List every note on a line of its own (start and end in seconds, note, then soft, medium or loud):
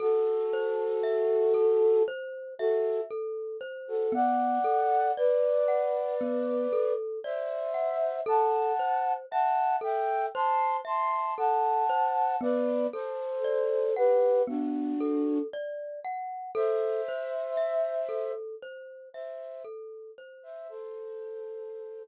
0.00 2.03 F#4 loud
0.00 0.46 A4 medium
0.00 2.03 A4 loud
0.53 1.00 C5 medium
1.03 1.50 E5 medium
1.54 2.01 A4 medium
2.08 2.54 C5 medium
2.59 3.01 F#4 medium
2.59 3.01 A4 loud
2.59 3.06 E5 medium
3.11 3.57 A4 medium
3.61 4.07 C5 medium
3.88 4.13 F#4 medium
3.88 4.13 A4 medium
4.12 4.59 B3 medium
4.12 5.12 D5 medium
4.12 5.12 F#5 loud
4.64 5.11 A4 medium
5.17 6.93 B4 medium
5.17 6.93 D5 loud
5.17 5.64 D5 medium
5.68 6.15 F#5 medium
6.21 6.67 B3 medium
6.73 7.19 A4 medium
7.24 8.21 C5 medium
7.24 7.71 D5 medium
7.24 8.21 E5 loud
7.74 8.21 F#5 medium
8.26 8.73 A4 medium
8.26 9.13 F#5 medium
8.26 9.13 A5 loud
8.79 9.26 C5 medium
9.31 9.78 E5 medium
9.31 9.76 F#5 loud
9.31 9.76 A5 loud
9.81 10.28 A4 medium
9.81 10.26 E5 loud
9.81 10.26 G5 loud
10.34 10.81 C5 medium
10.34 10.77 A5 medium
10.34 10.77 C6 loud
10.85 11.31 E5 medium
10.85 11.34 A5 medium
10.85 11.34 C6 loud
11.38 11.84 A4 medium
11.38 12.36 F#5 medium
11.38 12.36 A5 loud
11.89 12.36 C5 medium
12.41 12.87 B3 medium
12.41 12.87 B4 loud
12.41 12.87 D5 loud
12.93 13.94 A4 medium
12.93 13.40 A4 medium
12.93 13.94 C5 loud
13.44 13.91 D5 medium
13.96 14.42 G4 medium
13.96 14.42 B4 loud
13.96 14.43 F#5 medium
14.47 14.94 B3 medium
14.47 15.39 D4 medium
14.47 15.39 F#4 loud
15.00 15.47 A4 medium
15.53 16.00 D5 medium
16.05 16.51 F#5 medium
16.55 17.01 A4 medium
16.55 18.32 C5 loud
16.55 18.32 E5 loud
17.08 17.55 C5 medium
17.57 18.04 E5 medium
18.09 18.55 A4 medium
18.63 19.09 C5 medium
19.14 19.63 C5 medium
19.14 19.63 E5 medium
19.14 19.61 E5 medium
19.64 20.11 A4 medium
20.18 20.65 C5 medium
20.43 20.68 C5 medium
20.43 20.68 E5 loud
20.69 22.03 A4 loud
20.69 22.03 C5 loud